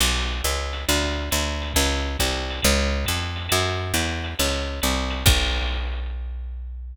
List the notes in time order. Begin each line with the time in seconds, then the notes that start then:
0.00 B1, crash, ride
0.44 C#2, hi-hat pedal, ride
0.73 ride
0.89 D2, ride
1.31 D2, hi-hat pedal, ride
1.62 ride
1.74 C#2, kick, ride
2.17 C2, kick, hi-hat pedal, ride
2.50 ride
2.62 C#2, kick, ride
3.05 F2, kick, hi-hat pedal, ride
3.36 ride
3.49 F#2, ride
3.94 E2, hi-hat pedal, ride
4.24 ride
4.39 C#2, ride
4.82 C2, hi-hat pedal, ride
5.10 ride
5.26 B1, kick, crash